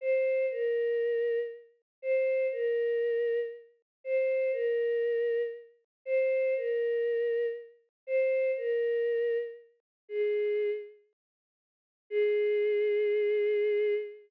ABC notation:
X:1
M:4/4
L:1/8
Q:1/4=119
K:Ab
V:1 name="Choir Aahs"
c2 B4 z2 | c2 B4 z2 | c2 B4 z2 | c2 B4 z2 |
c2 B4 z2 | A3 z5 | A8 |]